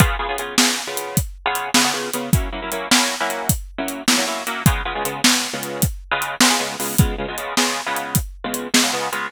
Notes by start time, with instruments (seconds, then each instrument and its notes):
0.00 acoustic guitar (steel) C#3 B3 F4 G#4, kick, closed hi-hat
0.19 acoustic guitar (steel) C#3 B3 F4 G#4
0.29 acoustic guitar (steel) C#3 B3 F4 G#4
0.38 acoustic guitar (steel) C#3 B3 F4 G#4, closed hi-hat
0.58 acoustic guitar (steel) C#3 B3 F4 G#4, snare
0.87 acoustic guitar (steel) C#3 B3 F4 G#4
0.97 closed hi-hat
1.17 kick, closed hi-hat
1.46 acoustic guitar (steel) C#3 B3 F4 G#4
1.55 closed hi-hat
1.74 acoustic guitar (steel) C#3 B3 F4 G#4, snare
1.85 acoustic guitar (steel) C#3 B3 F4 G#4
1.94 acoustic guitar (steel) C#3 B3 F4 G#4
2.13 acoustic guitar (steel) C#3 B3 F4 G#4, closed hi-hat
2.33 acoustic guitar (steel) F#3 A#3 C#4 E4, kick, closed hi-hat
2.52 acoustic guitar (steel) F#3 A#3 C#4 E4
2.62 acoustic guitar (steel) F#3 A#3 C#4 E4
2.72 acoustic guitar (steel) F#3 A#3 C#4 E4, closed hi-hat
2.91 acoustic guitar (steel) F#3 A#3 C#4 E4, snare
3.20 acoustic guitar (steel) F#3 A#3 C#4 E4
3.30 closed hi-hat
3.49 kick, closed hi-hat
3.78 acoustic guitar (steel) F#3 A#3 C#4 E4
3.88 closed hi-hat
4.08 acoustic guitar (steel) F#3 A#3 C#4 E4, snare
4.18 acoustic guitar (steel) F#3 A#3 C#4 E4
4.27 acoustic guitar (steel) F#3 A#3 C#4 E4
4.47 acoustic guitar (steel) F#3 A#3 C#4 E4, closed hi-hat
4.66 acoustic guitar (steel) C#3 G#3 B3 F4, kick, closed hi-hat
4.85 acoustic guitar (steel) C#3 G#3 B3 F4
4.95 acoustic guitar (steel) C#3 G#3 B3 F4
5.05 acoustic guitar (steel) C#3 G#3 B3 F4, closed hi-hat
5.24 acoustic guitar (steel) C#3 G#3 B3 F4, snare
5.53 acoustic guitar (steel) C#3 G#3 B3 F4
5.63 closed hi-hat
5.82 kick, closed hi-hat
6.11 acoustic guitar (steel) C#3 G#3 B3 F4
6.22 closed hi-hat
6.40 acoustic guitar (steel) C#3 G#3 B3 F4, snare
6.50 acoustic guitar (steel) C#3 G#3 B3 F4
6.60 acoustic guitar (steel) C#3 G#3 B3 F4
6.80 acoustic guitar (steel) C#3 G#3 B3 F4, open hi-hat
6.98 acoustic guitar (steel) C#3 G#3 B3 F4, kick, closed hi-hat
7.18 acoustic guitar (steel) C#3 G#3 B3 F4
7.28 acoustic guitar (steel) C#3 G#3 B3 F4
7.38 acoustic guitar (steel) C#3 G#3 B3 F4, closed hi-hat
7.57 acoustic guitar (steel) C#3 G#3 B3 F4, snare
7.86 acoustic guitar (steel) C#3 G#3 B3 F4
7.96 closed hi-hat
8.15 kick, closed hi-hat
8.44 acoustic guitar (steel) C#3 G#3 B3 F4
8.54 closed hi-hat
8.74 acoustic guitar (steel) C#3 G#3 B3 F4, snare
8.83 acoustic guitar (steel) C#3 G#3 B3 F4
8.93 acoustic guitar (steel) C#3 G#3 B3 F4
9.12 acoustic guitar (steel) C#3 G#3 B3 F4, closed hi-hat